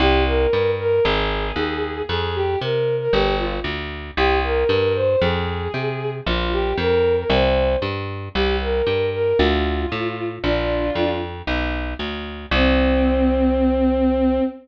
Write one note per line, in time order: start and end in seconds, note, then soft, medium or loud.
0.00 0.47 C2 loud
0.00 0.23 G4 loud
0.26 0.68 A#4 medium
0.53 1.00 G2 medium
0.79 1.01 A#4 medium
1.04 1.52 G#1 loud
1.04 2.01 G#4 medium
1.56 2.03 D#2 medium
2.09 2.56 F2 medium
2.09 2.34 G#4 medium
2.35 2.58 G4 medium
2.61 3.08 C3 medium
2.61 2.93 A#4 medium
3.00 3.12 A#4 medium
3.13 3.60 G1 medium
3.13 3.35 G4 medium
3.39 3.52 F4 medium
3.64 4.11 D2 medium
4.17 4.64 C2 medium
4.17 4.39 G4 loud
4.44 4.92 A#4 medium
4.69 5.16 G2 medium
4.95 5.20 C5 medium
5.22 5.68 F2 medium
5.22 6.10 G#4 medium
5.74 6.21 C3 medium
6.26 6.73 A#1 medium
6.26 6.48 F4 medium
6.52 6.77 G4 medium
6.77 7.24 F2 medium
6.77 7.12 A#4 medium
7.18 7.30 A#4 medium
7.30 7.77 C2 loud
7.30 7.73 C5 medium
7.82 8.29 G2 medium
8.35 8.82 C2 medium
8.35 8.56 G4 medium
8.61 9.06 A#4 medium
8.87 9.33 G2 medium
9.13 9.37 A#4 medium
9.39 9.86 D2 loud
9.39 10.25 F4 medium
9.92 10.39 A2 medium
10.43 10.91 A#1 medium
10.43 11.12 D4 medium
10.43 11.12 F4 medium
10.95 11.42 F2 medium
11.47 11.94 B1 medium
11.99 12.46 D2 medium
12.51 14.40 C2 loud
12.51 14.40 C4 loud